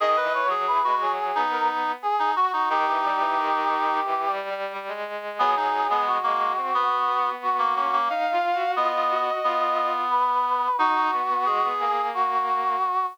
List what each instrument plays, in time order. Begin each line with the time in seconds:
0.00 violin D#3, clarinet G#4, brass section D#5
0.17 clarinet B4
0.23 violin E3
0.34 brass section C#5
0.45 violin F#3
0.50 clarinet G#4
0.67 violin E3, brass section B4
0.84 violin G#3, clarinet F#4
1.01 violin F#3, brass section G#4
1.35 violin B3, clarinet D#4
1.51 brass section A#4
2.02 brass section G#4
2.19 clarinet D#4
2.36 clarinet F#4, brass section F#4
2.53 clarinet D#4, brass section F#4
2.69 violin D#3, clarinet D#4, brass section G4
2.87 violin E3
3.04 violin G3
3.20 violin E3
3.37 violin D#3
4.05 violin E3
4.27 violin G3
4.50 violin G3
4.73 violin G3
4.88 violin G#3
5.39 violin F#3, clarinet B3, brass section G#4
5.56 violin F#3, clarinet D#4
5.89 violin G#3, clarinet B3
6.06 brass section F#4
6.23 violin G#3, clarinet A#3
6.57 violin C4
6.73 violin B3, clarinet B3
7.07 violin B3
7.42 brass section F#4
7.59 clarinet A#3
7.75 clarinet A#3, violin C#4
7.93 clarinet A#3
8.09 violin D#4, brass section F5
8.32 violin F4
8.54 violin F#4
8.76 clarinet B3, violin F4, brass section D#5
8.94 violin F4
9.10 violin F#4
9.44 clarinet B3, violin F4
10.11 brass section B4
10.78 violin D#4, clarinet D#4, brass section F#4
11.12 violin B3
11.29 violin B3
11.46 violin G#3, clarinet G#4
11.62 violin B3
11.80 violin A#3, brass section G#4
12.14 brass section F#4